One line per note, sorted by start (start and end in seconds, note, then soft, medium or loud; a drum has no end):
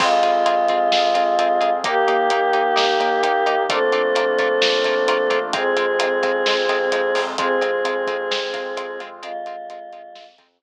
0.00 0.20 F2 loud
0.00 1.72 G#3 medium
0.00 0.09 C4 medium
0.00 1.82 C4 medium
0.00 0.09 F4 medium
0.00 1.82 F4 medium
0.00 1.72 F4 medium
0.00 0.09 G#4 medium
0.00 1.82 G#4 medium
0.00 kick loud
0.00 crash loud
0.23 0.43 F2 medium
0.23 0.32 C4 medium
0.23 0.32 F4 medium
0.23 0.32 G#4 medium
0.23 closed hi-hat medium
0.46 0.66 F2 medium
0.46 0.55 C4 medium
0.46 0.55 F4 medium
0.46 0.55 G#4 medium
0.46 closed hi-hat loud
0.68 0.89 F2 medium
0.68 0.79 C4 medium
0.68 0.79 F4 medium
0.68 0.79 G#4 medium
0.68 kick medium
0.68 closed hi-hat medium
0.92 1.12 F2 medium
0.92 1.02 C4 medium
0.92 1.02 F4 medium
0.92 1.02 G#4 medium
0.92 snare loud
1.14 1.35 F2 medium
1.14 1.24 C4 medium
1.14 1.24 F4 medium
1.14 1.24 G#4 medium
1.14 closed hi-hat medium
1.39 1.58 F2 medium
1.39 1.48 C4 medium
1.39 1.48 F4 medium
1.39 1.48 G#4 medium
1.39 closed hi-hat medium
1.61 1.81 F2 medium
1.61 1.70 C4 medium
1.61 1.70 F4 medium
1.61 1.70 G#4 medium
1.61 closed hi-hat medium
1.83 2.04 D#2 medium
1.83 3.66 A#3 medium
1.83 3.62 A#3 medium
1.83 1.94 A#3 medium
1.83 3.66 D#4 medium
1.83 1.94 D#4 medium
1.83 3.66 G4 medium
1.83 3.62 G4 loud
1.83 1.94 G4 medium
1.83 kick loud
1.83 closed hi-hat loud
2.08 2.27 D#2 medium
2.08 2.17 A#3 medium
2.08 2.17 D#4 medium
2.08 2.17 G4 medium
2.08 closed hi-hat medium
2.30 2.50 D#2 medium
2.30 2.40 A#3 medium
2.30 2.40 D#4 medium
2.30 2.40 G4 medium
2.30 closed hi-hat loud
2.53 2.74 D#2 medium
2.53 2.62 A#3 medium
2.53 2.62 D#4 medium
2.53 2.62 G4 medium
2.53 closed hi-hat medium
2.76 2.97 D#2 medium
2.76 2.85 A#3 medium
2.76 2.85 D#4 medium
2.76 2.85 G4 medium
2.76 snare loud
3.00 3.20 D#2 medium
3.00 3.09 A#3 medium
3.00 3.09 D#4 medium
3.00 3.09 G4 medium
3.00 closed hi-hat medium
3.23 3.43 D#2 medium
3.23 3.32 A#3 medium
3.23 3.32 D#4 medium
3.23 3.32 G4 medium
3.23 closed hi-hat loud
3.46 3.66 D#2 medium
3.46 3.55 A#3 medium
3.46 3.55 D#4 medium
3.46 3.55 G4 medium
3.46 closed hi-hat medium
3.69 3.89 A#1 medium
3.69 3.79 A3 medium
3.69 5.53 A3 medium
3.69 3.79 A#3 medium
3.69 5.53 A#3 medium
3.69 5.38 C4 loud
3.69 3.79 D4 medium
3.69 5.53 D4 medium
3.69 3.79 F4 medium
3.69 5.53 F4 medium
3.69 5.38 A4 loud
3.69 kick loud
3.69 closed hi-hat loud
3.92 4.12 A#1 medium
3.92 4.02 A3 medium
3.92 4.02 A#3 medium
3.92 4.02 D4 medium
3.92 4.02 F4 medium
3.92 closed hi-hat medium
4.15 4.35 A#1 medium
4.15 4.25 A3 medium
4.15 4.25 A#3 medium
4.15 4.25 D4 medium
4.15 4.25 F4 medium
4.15 closed hi-hat loud
4.38 4.58 A#1 medium
4.38 4.48 A3 medium
4.38 4.48 A#3 medium
4.38 4.48 D4 medium
4.38 4.48 F4 medium
4.38 kick medium
4.38 closed hi-hat medium
4.62 4.81 A#1 medium
4.62 4.71 A3 medium
4.62 4.71 A#3 medium
4.62 4.71 D4 medium
4.62 4.71 F4 medium
4.62 snare loud
4.84 5.04 A#1 medium
4.84 4.95 A3 medium
4.84 4.95 A#3 medium
4.84 4.95 D4 medium
4.84 4.95 F4 medium
4.84 kick medium
4.84 closed hi-hat medium
5.08 5.27 A#1 medium
5.08 5.17 A3 medium
5.08 5.17 A#3 medium
5.08 5.17 D4 medium
5.08 5.17 F4 medium
5.08 closed hi-hat loud
5.30 5.50 A#1 medium
5.30 5.39 A3 medium
5.30 5.39 A#3 medium
5.30 5.39 D4 medium
5.30 5.39 F4 medium
5.30 kick medium
5.30 closed hi-hat medium
5.53 5.73 F2 loud
5.53 7.36 G#3 medium
5.53 5.63 G#3 medium
5.53 7.36 C4 medium
5.53 7.20 C4 medium
5.53 5.63 C4 medium
5.53 7.36 F4 medium
5.53 5.63 F4 medium
5.53 7.20 G#4 loud
5.53 kick loud
5.53 closed hi-hat loud
5.77 5.97 F2 medium
5.77 5.86 G#3 medium
5.77 5.86 C4 medium
5.77 5.86 F4 medium
5.77 closed hi-hat medium
5.99 6.20 F2 medium
5.99 6.09 G#3 medium
5.99 6.09 C4 medium
5.99 6.09 F4 medium
5.99 closed hi-hat loud
6.23 6.43 F2 medium
6.23 6.32 G#3 medium
6.23 6.32 C4 medium
6.23 6.32 F4 medium
6.23 kick medium
6.23 closed hi-hat medium
6.46 6.66 F2 medium
6.46 6.56 G#3 medium
6.46 6.56 C4 medium
6.46 6.56 F4 medium
6.46 snare loud
6.69 6.89 F2 medium
6.69 6.78 G#3 medium
6.69 6.78 C4 medium
6.69 6.78 F4 medium
6.69 closed hi-hat medium
6.92 7.12 F2 medium
6.92 7.01 G#3 medium
6.92 7.01 C4 medium
6.92 7.01 F4 medium
6.92 closed hi-hat medium
7.15 7.35 F2 medium
7.15 7.24 G#3 medium
7.15 7.24 C4 medium
7.15 7.24 F4 medium
7.15 open hi-hat medium
7.38 7.58 F2 medium
7.38 7.48 G#3 medium
7.38 9.22 G#3 medium
7.38 9.00 C4 medium
7.38 7.48 C4 medium
7.38 9.22 C4 medium
7.38 7.48 F4 medium
7.38 9.22 F4 medium
7.38 9.00 G#4 loud
7.38 kick loud
7.38 closed hi-hat loud
7.61 7.81 F2 medium
7.61 7.71 G#3 medium
7.61 7.71 C4 medium
7.61 7.71 F4 medium
7.61 closed hi-hat medium
7.85 8.04 F2 medium
7.85 7.94 G#3 medium
7.85 7.94 C4 medium
7.85 7.94 F4 medium
7.85 closed hi-hat medium
8.07 8.27 F2 medium
8.07 8.17 G#3 medium
8.07 8.17 C4 medium
8.07 8.17 F4 medium
8.07 kick medium
8.07 closed hi-hat medium
8.31 8.50 F2 medium
8.31 8.40 G#3 medium
8.31 8.40 C4 medium
8.31 8.40 F4 medium
8.31 snare loud
8.53 8.74 F2 medium
8.53 8.63 G#3 medium
8.53 8.63 C4 medium
8.53 8.63 F4 medium
8.53 kick medium
8.53 closed hi-hat medium
8.77 8.97 F2 medium
8.77 8.86 G#3 medium
8.77 8.86 C4 medium
8.77 8.86 F4 medium
8.77 closed hi-hat loud
9.00 9.20 F2 medium
9.00 9.09 G#3 medium
9.00 9.09 C4 medium
9.00 9.09 F4 medium
9.00 closed hi-hat medium
9.23 9.43 F2 medium
9.23 9.32 G#3 medium
9.23 10.25 G#3 loud
9.23 9.32 C4 medium
9.23 9.32 F4 medium
9.23 10.25 F4 loud
9.23 closed hi-hat medium
9.46 9.66 F2 medium
9.46 9.56 G#3 medium
9.46 9.56 C4 medium
9.46 9.56 F4 medium
9.46 closed hi-hat medium
9.69 9.89 F2 medium
9.69 9.79 G#3 medium
9.69 9.79 C4 medium
9.69 9.79 F4 medium
9.69 closed hi-hat loud
9.92 10.12 F2 medium
9.92 10.02 G#3 medium
9.92 10.02 C4 medium
9.92 10.02 F4 medium
9.92 closed hi-hat medium
10.15 10.35 F2 medium
10.15 10.25 G#3 medium
10.15 10.25 C4 medium
10.15 10.25 F4 medium
10.15 snare loud
10.38 10.58 F2 medium
10.38 10.48 G#3 medium
10.38 10.48 C4 medium
10.38 10.48 F4 medium
10.38 kick medium
10.38 closed hi-hat medium
10.62 10.62 F2 medium
10.62 10.62 G#3 medium
10.62 10.62 C4 medium
10.62 10.62 F4 medium